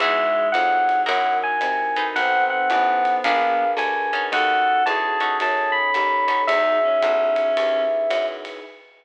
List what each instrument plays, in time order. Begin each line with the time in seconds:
0.00 electric bass (finger) E2, clarinet G#3, pad 5 (bowed) D#4 E4 F#4 G#4, acoustic guitar (steel) D#4 E4 F#4 G#4, electric piano 1 E5, kick, ride
0.52 electric bass (finger) F2, clarinet F#3, electric piano 1 F#5, hi-hat pedal, ride
0.89 ride
1.06 electric bass (finger) F#2, acoustic guitar (steel) D#4 E4 F#4 A#4, pad 5 (bowed) D#4 E4 F#4 A#4, electric piano 1 F#5, ride
1.43 electric piano 1 G#5
1.61 electric bass (finger) C3, hi-hat pedal, ride
1.96 acoustic guitar (steel) D#4 A4 B4 C5, ride
2.16 electric bass (finger) B1, clarinet C4, pad 5 (bowed) D#4 A4 B4 C5, electric piano 1 F#5, ride
2.50 electric piano 1 F#5
2.70 electric bass (finger) A1, clarinet B3, hi-hat pedal, ride
3.05 ride
3.24 electric bass (finger) A#1, pad 5 (bowed) D4 G#4 A#4 B4, acoustic guitar (steel) D4 G#4 A#4 B4, electric piano 1 F5, kick, ride
3.77 electric bass (finger) D2, electric piano 1 G#5, hi-hat pedal, ride
4.13 acoustic guitar (steel) C#4 D#4 F#4 A4, ride
4.32 electric bass (finger) D#2, pad 5 (bowed) C#4 D#4 F#4 A4, clarinet A4, electric piano 1 F#5, ride
4.86 electric bass (finger) E2, clarinet G#4, electric piano 1 A5, hi-hat pedal, ride
5.20 acoustic guitar (steel) C#4 D#4 F#4 A4, ride
5.40 electric bass (finger) F#2, pad 5 (bowed) C#4 D#4 A4 C#5, electric piano 1 A5, ride
5.72 electric piano 1 B5
5.94 electric bass (finger) D#2, hi-hat pedal, ride
6.28 acoustic guitar (steel) C#4 D#4 F#4 A4, ride
6.47 electric bass (finger) E2, pad 5 (bowed) D#4 E4 F#4 G#4, clarinet D#4, electric piano 1 E5, ride
6.83 clarinet C#4
7.02 electric bass (finger) B1, kick, hi-hat pedal, ride
7.36 ride
7.57 electric bass (finger) D#2, pad 5 (bowed) D#4 E4 G#4 B4, ride
8.10 electric bass (finger) F#2, hi-hat pedal, ride
8.45 ride